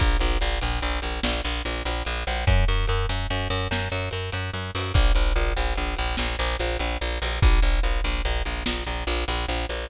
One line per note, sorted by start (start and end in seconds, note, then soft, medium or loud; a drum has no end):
0.00 0.17 A#1 medium
0.00 kick medium
0.00 closed hi-hat loud
0.19 0.38 A#1 medium
0.19 closed hi-hat medium
0.41 0.59 A#1 medium
0.41 closed hi-hat medium
0.61 0.80 A#1 medium
0.61 closed hi-hat medium
0.81 1.00 A#1 medium
0.81 closed hi-hat medium
1.02 1.20 A#1 medium
1.02 closed hi-hat medium
1.23 1.41 A#1 medium
1.23 snare loud
1.45 1.62 A#1 medium
1.45 closed hi-hat medium
1.65 1.83 A#1 medium
1.65 closed hi-hat medium
1.85 2.03 A#1 medium
1.85 closed hi-hat loud
2.05 2.24 A#1 medium
2.05 closed hi-hat medium
2.27 2.45 A#1 medium
2.27 open hi-hat medium
2.47 2.65 F#2 medium
2.47 kick medium
2.47 closed hi-hat medium
2.68 2.86 F#2 medium
2.68 closed hi-hat medium
2.87 3.06 F#2 medium
2.87 closed hi-hat medium
3.09 3.27 F#2 medium
3.09 closed hi-hat medium
3.30 3.48 F#2 medium
3.30 closed hi-hat medium
3.50 3.68 F#2 medium
3.50 closed hi-hat medium
3.71 3.89 F#2 medium
3.71 snare medium
3.92 4.09 F#2 medium
3.92 closed hi-hat medium
4.11 4.30 F#2 medium
4.11 closed hi-hat medium
4.32 4.51 F#2 medium
4.32 closed hi-hat medium
4.53 4.71 F#2 medium
4.53 closed hi-hat medium
4.75 4.92 F#2 medium
4.75 open hi-hat medium
4.94 5.12 A#1 medium
4.94 kick medium
4.94 closed hi-hat medium
5.15 5.33 A#1 medium
5.15 closed hi-hat medium
5.36 5.53 A#1 medium
5.36 closed hi-hat medium
5.57 5.74 A#1 medium
5.57 closed hi-hat medium
5.75 5.95 A#1 medium
5.75 closed hi-hat medium
5.96 6.16 A#1 medium
5.96 closed hi-hat medium
6.17 6.36 A#1 medium
6.17 snare medium
6.39 6.56 A#1 medium
6.39 closed hi-hat medium
6.59 6.77 A#1 medium
6.59 closed hi-hat medium
6.79 6.97 A#1 medium
6.79 closed hi-hat medium
7.01 7.19 A#1 medium
7.01 closed hi-hat medium
7.22 7.39 A#1 medium
7.22 open hi-hat medium
7.42 7.60 A#1 medium
7.42 kick loud
7.42 closed hi-hat loud
7.62 7.80 A#1 medium
7.62 closed hi-hat medium
7.83 8.01 A#1 medium
7.83 closed hi-hat medium
8.04 8.22 A#1 medium
8.04 closed hi-hat medium
8.25 8.42 A#1 medium
8.25 closed hi-hat medium
8.45 8.63 A#1 medium
8.45 closed hi-hat medium
8.66 8.84 A#1 medium
8.66 snare loud
8.87 9.04 A#1 medium
8.87 closed hi-hat medium
9.07 9.24 A#1 medium
9.07 closed hi-hat medium
9.28 9.46 A#1 medium
9.28 closed hi-hat loud
9.48 9.66 A#1 medium
9.48 closed hi-hat medium
9.69 9.87 A#1 medium
9.69 closed hi-hat medium